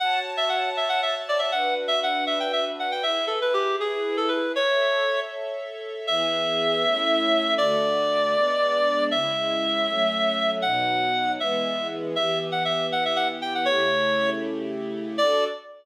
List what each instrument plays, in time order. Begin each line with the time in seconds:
0.00 string ensemble 1 F#4 C#5 A5, clarinet F#5
0.37 clarinet E5
0.49 clarinet F#5
0.77 clarinet E5
0.89 clarinet F#5
1.03 clarinet E5
1.29 clarinet D5
1.39 clarinet E5
1.52 string ensemble 1 D4 F#4 B4, clarinet F#5
1.88 clarinet E5
2.03 clarinet F#5
2.27 clarinet E5
2.40 clarinet G5
2.53 clarinet E5
2.79 clarinet F#5
2.92 clarinet G5
3.03 string ensemble 1 E4 G#4 B4, clarinet E5
3.27 clarinet A4
3.42 clarinet B4
3.54 clarinet G4
3.80 clarinet G#4
4.17 clarinet A4
4.28 clarinet B4
4.56 string ensemble 1 A4 C#5 E5, clarinet C#5
6.07 string ensemble 1 E3 B3 G#4, clarinet E5
6.84 string ensemble 1 A3 C#4 E4
7.58 string ensemble 1 D3 A3 F#4, clarinet D5
8.35 string ensemble 1 G#3 B3 D4
9.11 string ensemble 1 C#3 G#3 E4, clarinet E5
9.87 string ensemble 1 F#3 A3 C#4
10.62 string ensemble 1 B2 F#3 D#4, clarinet F#5
11.39 string ensemble 1 E3 G#3 B3, clarinet E5
12.15 string ensemble 1 E3 B3 G4, clarinet E5
12.52 clarinet F#5
12.65 clarinet E5
12.92 clarinet F#5
13.05 clarinet E5
13.16 clarinet F#5
13.42 clarinet G5
13.55 clarinet F#5
13.65 string ensemble 1 C#3 A3 E4 G4, clarinet C#5
15.18 string ensemble 1 D4 F#4 A4, clarinet D5